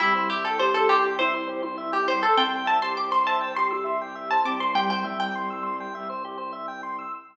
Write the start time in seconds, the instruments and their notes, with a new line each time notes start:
0.00 violin C2, acoustic grand piano G3, pizzicato strings E4, drawbar organ G4
0.15 drawbar organ C5
0.30 pizzicato strings G4, drawbar organ E5
0.44 acoustic grand piano E4, pizzicato strings A4, drawbar organ G5
0.59 acoustic grand piano G4, pizzicato strings C5, drawbar organ C6
0.74 pizzicato strings A4, drawbar organ E6
0.89 pizzicato strings G4, drawbar organ C6
1.03 drawbar organ G5
1.19 acoustic grand piano E4, pizzicato strings C5, drawbar organ E5
1.34 acoustic grand piano E4, drawbar organ C5
1.48 drawbar organ G4, acoustic grand piano C5
1.63 acoustic grand piano E4, drawbar organ C5
1.78 drawbar organ E5
1.92 pizzicato strings G4, drawbar organ G5
2.08 acoustic grand piano G3, pizzicato strings C5, drawbar organ C6
2.22 pizzicato strings A4, drawbar organ E6
2.37 violin C2, acoustic grand piano C4, pizzicato strings G5, drawbar organ C6
2.53 drawbar organ G5
2.66 drawbar organ E5, pizzicato strings A5
2.82 acoustic grand piano G4, drawbar organ C5, pizzicato strings C6
2.97 drawbar organ G4, acoustic grand piano C5, pizzicato strings D6
3.11 drawbar organ C5, pizzicato strings C6
3.26 drawbar organ E5, pizzicato strings A5
3.41 drawbar organ G5
3.55 acoustic grand piano G4, drawbar organ C6, pizzicato strings C6
3.71 acoustic grand piano G4, drawbar organ E6
3.84 acoustic grand piano E5, drawbar organ C6
4.00 acoustic grand piano G4, drawbar organ G5
4.15 drawbar organ E5
4.31 drawbar organ C5, pizzicato strings A5
4.45 violin C2, acoustic grand piano C4, drawbar organ G4, pizzicato strings D6
4.60 drawbar organ C5, pizzicato strings C6
4.75 acoustic grand piano G3, drawbar organ G4, pizzicato strings G5
4.90 drawbar organ C5, pizzicato strings G5
5.04 acoustic grand piano G3, drawbar organ E5
5.20 pizzicato strings G5, drawbar organ G5
5.35 drawbar organ C6
5.50 drawbar organ E6
5.63 drawbar organ C6
5.80 drawbar organ G5
5.94 violin C2, drawbar organ E5
6.09 drawbar organ C5
6.25 drawbar organ G4
6.38 drawbar organ C5
6.53 drawbar organ E5
6.68 drawbar organ G5
6.83 drawbar organ C6
6.99 drawbar organ E6